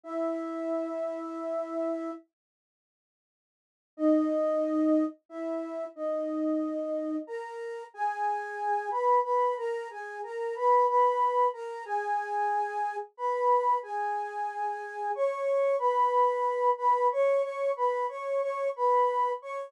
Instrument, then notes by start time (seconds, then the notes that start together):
flute
0.04 E4 E5
3.97 D#4 D#5
5.29 E4 E5
5.96 D#4 D#5
7.27 A#4 A#5
7.94 G#4 G#5
8.90 B4 B5
9.23 B4 B5
9.57 A#4 A#5
9.90 G#4 G#5
10.23 A#4 A#5
10.55 B4 B5
10.88 B4 B5
11.53 A#4 A#5
11.85 G#4 G#5
13.17 B4 B5
13.83 G#4 G#5
15.15 C#5 C#6
15.79 B4 B5
16.77 B4 B5
17.12 C#5 C#6
17.42 C#5 C#6
17.76 B4 B5
18.09 C#5 C#6
18.41 C#5 C#6
18.76 B4 B5
19.42 C#5 C#6